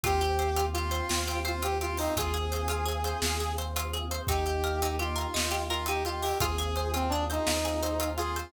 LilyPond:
<<
  \new Staff \with { instrumentName = "Brass Section" } { \time 12/8 \key ees \major \tempo 4. = 113 g'2 f'2 f'8 g'8 f'8 ees'8 | aes'1~ aes'8 r4. | g'2 f'2 f'8 g'8 f'8 g'8 | aes'4. c'8 d'8 ees'2~ ees'8 f'4 | }
  \new Staff \with { instrumentName = "Orchestral Harp" } { \time 12/8 \key ees \major f'8 g'8 c''8 f'8 g'8 c''8 f'8 g'8 c''8 f'8 g'8 c''8 | f'8 aes'8 c''8 f'8 aes'8 c''8 f'8 aes'8 c''8 f'8 aes'8 c''8 | ees'8 g'8 bes'8 ees'8 g'8 bes'8 ees'8 g'8 bes'8 ees'8 g'8 bes'8 | f'8 aes'8 c''8 f'8 aes'8 c''8 f'8 aes'8 c''8 f'8 aes'8 c''8 | }
  \new Staff \with { instrumentName = "Synth Bass 2" } { \clef bass \time 12/8 \key ees \major ees,2. ees,2. | ees,2. ees,2. | ees,2. ees,2. | ees,2. ees,2. | }
  \new Staff \with { instrumentName = "Choir Aahs" } { \time 12/8 \key ees \major <c' f' g'>1. | <c' f' aes'>1. | <bes ees' g'>1. | <c' f' aes'>1. | }
  \new DrumStaff \with { instrumentName = "Drums" } \drummode { \time 12/8 <hh bd>8 hh8 hh8 hh8 hh8 hh8 sn8 hh8 hh8 hh8 hh8 hho8 | <hh bd>8 hh8 hh8 hh8 hh8 hh8 sn8 hh8 hh8 hh8 hh8 hh8 | <hh bd>8 hh8 hh8 hh8 hh8 hh8 sn8 hh8 hh8 hh8 hh8 hho8 | <hh bd>8 hh8 hh8 hh8 hh8 hh8 sn8 hh8 hh8 hh8 hh8 hh8 | }
>>